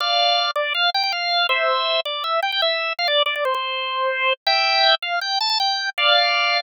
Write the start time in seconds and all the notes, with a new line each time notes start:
0.00 D5 F5
0.56 D5
0.75 F5
0.94 G5
1.03 G5
1.12 F5
1.49 C5 E5
2.05 D5
2.24 E5
2.42 G5
2.52 G5
2.62 E5
2.99 F5
3.08 D5
3.26 D5
3.36 D5
3.45 C5
3.55 C5
4.47 E5 G5
5.02 F5
5.21 G5
5.41 A5
5.50 A5
5.60 G5
5.98 D5 F5